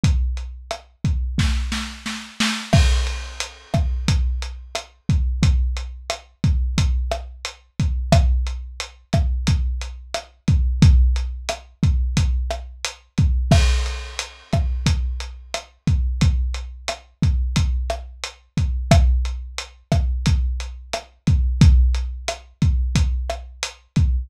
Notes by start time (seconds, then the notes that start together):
0.04 kick, closed hi-hat
0.37 closed hi-hat
0.71 cross-stick, closed hi-hat
1.04 kick, closed hi-hat
1.38 kick, snare
1.72 snare
2.06 snare
2.40 snare
2.73 kick, cross-stick, crash
3.07 closed hi-hat
3.40 closed hi-hat
3.74 kick, cross-stick, closed hi-hat
4.08 kick, closed hi-hat
4.42 closed hi-hat
4.75 cross-stick, closed hi-hat
5.09 kick, closed hi-hat
5.43 kick, closed hi-hat
5.77 closed hi-hat
6.10 cross-stick, closed hi-hat
6.44 kick, closed hi-hat
6.78 kick, closed hi-hat
7.12 cross-stick, closed hi-hat
7.45 closed hi-hat
7.80 kick, closed hi-hat
8.12 kick, cross-stick, closed hi-hat
8.47 closed hi-hat
8.80 closed hi-hat
9.13 kick, cross-stick, closed hi-hat
9.47 kick, closed hi-hat
9.81 closed hi-hat
10.14 cross-stick, closed hi-hat
10.48 kick, closed hi-hat
10.82 kick, closed hi-hat
11.16 closed hi-hat
11.49 cross-stick, closed hi-hat
11.83 kick, closed hi-hat
12.17 kick, closed hi-hat
12.51 cross-stick, closed hi-hat
12.85 closed hi-hat
13.18 kick, closed hi-hat
13.51 kick, cross-stick, crash
13.86 closed hi-hat
14.19 closed hi-hat
14.53 kick, cross-stick, closed hi-hat
14.86 kick, closed hi-hat
15.20 closed hi-hat
15.54 cross-stick, closed hi-hat
15.87 kick, closed hi-hat
16.21 kick, closed hi-hat
16.54 closed hi-hat
16.88 cross-stick, closed hi-hat
17.22 kick, closed hi-hat
17.56 kick, closed hi-hat
17.90 cross-stick, closed hi-hat
18.24 closed hi-hat
18.57 kick, closed hi-hat
18.91 kick, cross-stick, closed hi-hat
19.25 closed hi-hat
19.58 closed hi-hat
19.92 kick, cross-stick, closed hi-hat
20.26 kick, closed hi-hat
20.60 closed hi-hat
20.93 cross-stick, closed hi-hat
21.27 kick, closed hi-hat
21.61 kick, closed hi-hat
21.95 closed hi-hat
22.28 cross-stick, closed hi-hat
22.62 kick, closed hi-hat
22.95 kick, closed hi-hat
23.30 cross-stick, closed hi-hat
23.63 closed hi-hat
23.96 kick, closed hi-hat